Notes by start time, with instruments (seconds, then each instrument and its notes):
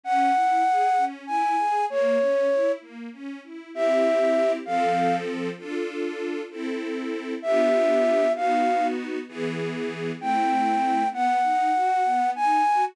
0.03 string ensemble 1 C#4, flute F#5
0.35 string ensemble 1 E4
0.66 string ensemble 1 G#4
0.97 string ensemble 1 C#4
1.27 string ensemble 1 E4, flute G#5
1.58 string ensemble 1 G#4
1.90 string ensemble 1 A#3, flute C#5
2.21 string ensemble 1 C#4
2.50 string ensemble 1 E4
2.81 string ensemble 1 A#3
3.12 string ensemble 1 C#4
3.43 string ensemble 1 E4
3.74 string ensemble 1 C4 E4 G4, flute E5
4.66 string ensemble 1 F3 C4 A4, flute F5
5.58 string ensemble 1 D4 F4 A4
6.51 string ensemble 1 C4 E4 A4
7.42 string ensemble 1 B3 D4 F4 G4, flute E5
8.35 string ensemble 1 B3 D#4 F#4, flute F5
9.28 string ensemble 1 E3 B3 G#4
10.20 string ensemble 1 A3 C4 E4, flute G5
11.12 string ensemble 1 B3, flute F#5
11.43 string ensemble 1 D#4
11.74 string ensemble 1 F#4
12.05 string ensemble 1 B3
12.35 string ensemble 1 D#4, flute G#5
12.66 string ensemble 1 F#4